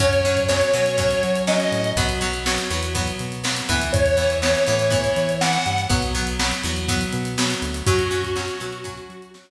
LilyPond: <<
  \new Staff \with { instrumentName = "Lead 1 (square)" } { \time 4/4 \key fis \mixolydian \tempo 4 = 122 cis''4 cis''2 dis''4 | r1 | cis''4 cis''2 fis''4 | r1 |
fis'2. r4 | }
  \new Staff \with { instrumentName = "Acoustic Guitar (steel)" } { \time 4/4 \key fis \mixolydian <fis cis'>8 <fis cis'>8 <fis cis'>8 <fis cis'>8 <fis cis'>4 <fis cis'>4 | <fis b>8 <fis b>8 <fis b>8 <fis b>8 <fis b>4 <fis b>8 <e b>8~ | <e b>8 <e b>8 <e b>8 <e b>8 <e b>4 <e b>4 | <fis b>8 <fis b>8 <fis b>8 <fis b>8 <fis b>4 <fis b>4 |
<fis cis'>8 <fis cis'>8 <fis cis'>8 <fis cis'>8 <fis cis'>4 <fis cis'>4 | }
  \new Staff \with { instrumentName = "Synth Bass 1" } { \clef bass \time 4/4 \key fis \mixolydian fis,4. b,4 fis4 a,8 | b,,4. e,4 b,4 d,8 | e,4. a,4 e4 g,8 | b,,4. e,4 b,4 d,8 |
fis,4. b,4 fis4 r8 | }
  \new DrumStaff \with { instrumentName = "Drums" } \drummode { \time 4/4 <hh bd>16 hh16 hh16 <hh bd>16 sn16 hh16 hh16 hh16 <hh bd>16 hh16 hh16 hh16 sn16 hh16 hh16 hh16 | <hh bd>16 hh16 hh16 hh16 sn16 hh16 hh16 hh16 <hh bd>16 hh16 hh16 hh16 sn16 hh16 <hh bd>16 hh16 | <hh bd>16 hh16 hh16 hh16 sn16 hh16 hh16 hh16 <hh bd>16 hh16 hh16 hh16 sn16 hh16 hh16 hh16 | <hh bd>16 hh16 hh16 hh16 sn16 hh16 hh16 hh16 <hh bd>16 hh16 hh16 hh16 sn16 hh16 hh16 hh16 |
<hh bd>16 hh16 hh16 <hh bd>16 sn16 hh16 hh16 hh16 <hh bd>16 hh16 hh16 hh16 sn16 hh8. | }
>>